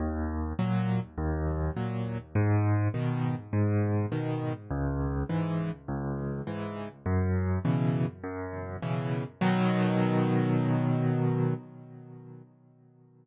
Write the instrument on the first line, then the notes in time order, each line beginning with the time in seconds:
acoustic grand piano
0.00 D#2
0.59 A#2 F#3
1.18 D#2
1.76 A#2 F#3
2.35 G#2
2.94 B2 D#3
3.53 G#2
4.12 B2 D#3
4.71 C#2
5.29 G#2 E3
5.88 C#2
6.47 G#2 E3
7.06 F#2
7.65 B2 C#3 E3
8.24 F#2
8.82 B2 C#3 E3
9.41 B2 D#3 F#3